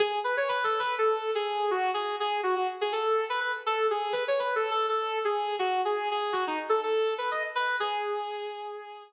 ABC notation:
X:1
M:4/4
L:1/16
Q:1/4=123
K:G#phr
V:1 name="Distortion Guitar"
G2 B c (3B2 A2 B2 A3 G3 F2 | G2 G2 F F z G A3 B B z A2 | G2 B c (3B2 A2 A2 A3 G3 F2 | G2 G2 F D z A A3 B d z B2 |
G12 z4 |]